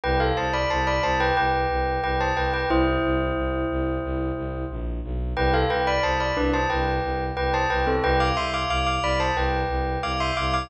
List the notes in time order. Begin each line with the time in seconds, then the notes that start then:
0.04 C2 B4 G5
0.20 A4 F5
0.37 C2 C5 A5
0.53 D5 B5
0.70 C2 C5 A5
0.87 D5 B5
1.03 C2 C5 A5
1.20 B4 G5
1.37 C2 B4 G5
1.70 C2
2.03 C2 B4 G5
2.20 C5 A5
2.37 C2 B4 G5
2.53 B4 G5
2.69 C2 E4 C5
3.04 C2
3.36 C2
3.70 C2
4.03 C2
4.37 C2
4.71 A#1
5.04 B1
5.36 C2 B4 G5
5.54 A4 F5
5.70 C2 B4 G5
5.87 D5 B5
6.03 C2 C5 A5
6.20 D5 B5
6.37 C2 D4 B4
6.53 C5 A5
6.70 C2 B4 G5
7.03 C2
7.37 C2 B4 G5
7.54 C5 A5
7.70 C2 B4 G5
7.87 C4 A4
8.03 C2 B4 G5
8.20 F5 D6
8.37 C2 E5 C6
8.54 F5 D6
8.70 C2 F5 D6
8.87 F5 D6
9.02 C2 D5 B5
9.20 C5 A5
9.36 C2 B4 G5
9.69 C2
10.03 C2 F5 D6
10.20 E5 C6
10.37 C2 F5 D6
10.54 F5 D6